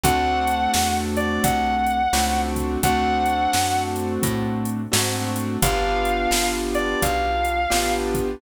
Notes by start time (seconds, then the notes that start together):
0.03 D2 A3 C4 D4 F#4 F#5, kick, closed hi-hat
0.47 closed hi-hat
0.74 E2, snare
1.17 D5, closed hi-hat
1.44 C2 F#5, kick, closed hi-hat
1.86 closed hi-hat
2.13 C#2 A3 C4 D4 F#4, snare
2.56 kick, closed hi-hat
2.83 D2 A3 C4 D4 F#4 F#5, kick, closed hi-hat
3.26 closed hi-hat
3.53 F#2, snare
3.96 closed hi-hat
4.23 A2, kick, closed hi-hat
4.65 closed hi-hat
4.92 G#2 A3 C4 D4 F#4, snare
5.36 closed hi-hat
5.62 G1 B3 D4 F4 G4 F5, kick, closed hi-hat
6.05 closed hi-hat
6.31 G1, snare
6.75 D5, closed hi-hat
7.02 B1 F5, kick, closed hi-hat
7.45 closed hi-hat
7.70 A1 B3 D4 F4 G4, snare
8.14 kick, closed hi-hat